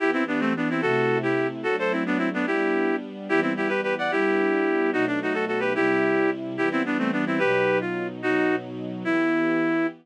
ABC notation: X:1
M:6/8
L:1/8
Q:3/8=146
K:Em
V:1 name="Clarinet"
[EG] [CE] [B,D] [A,C] [B,D] [CE] | [FA]3 [EG]2 z | [FA] [Ac] [CE] [B,D] [CE] [B,D] | [EG]4 z2 |
[EG] [CE] [EG] [GB] [GB] [df] | [EG]6 | [^DF] =D [^DF] [FA] [FA] [GB] | [EG]5 z |
[EG] [CE] [B,D] [A,C] [B,D] [CE] | [GB]3 ^E2 z | [^DF]3 z3 | E6 |]
V:2 name="String Ensemble 1"
[E,B,G]6 | [C,A,E]6 | [F,A,D]6 | [G,B,D]6 |
[E,G,B,]6 | [G,B,D]6 | [B,,F,A,^D]6 | [C,G,E]6 |
[E,G,B,]6 | [B,,F,^D]6 | [B,,F,^D]6 | [E,B,G]6 |]